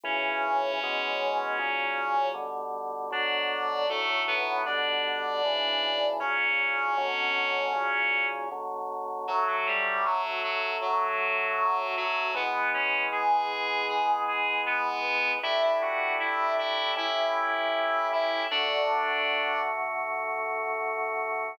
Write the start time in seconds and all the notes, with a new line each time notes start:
0.04 B1 A2 C#3 E3 C#4 C#5
0.83 B2 E3 G#3
1.59 B1 A#2 C#3 F#3
2.34 B2 D3 G3
3.11 B2 D3 F#3 D4 D5
3.89 B1 A2 D3 F#3 A3 A4
4.28 B3 B4
4.66 B2 D3 G3 D4 D5
5.45 B1 A2 C#3 E3
6.20 B1 A#2 C#3 F#3 C#4 C#5
6.98 B2 D3 F#3
7.73 B1 A#2 C#3 F#3
8.51 B2 D3 F#3
9.28 D3 F#3 A3 F#4
9.47 F#3 F#4
9.67 G3 G4
10.05 F#3 F#4
10.43 F#3 F#4
10.81 F#3 F#4
11.97 F#3 F#4
12.34 E3 G#3 B3 B4
12.74 C#4 C#5
13.12 G#4 G#5
13.89 G#4 G#5
14.28 G#4 G#5
14.66 B3 B4
15.43 A3 D4 E4 G4 E5
15.62 E4 E5
15.82 F#4 F#5
16.20 E4 E5
16.58 E4 E5
16.96 A3 C#4 E4 G4 E5
18.12 E4 E5
18.51 D3 A3 D4 F#4 D5